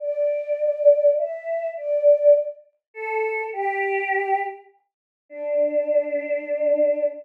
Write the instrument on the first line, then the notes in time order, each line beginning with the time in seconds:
choir aahs
0.00 D5
1.18 E5
1.77 D5
2.94 A4
3.53 G4
5.29 D4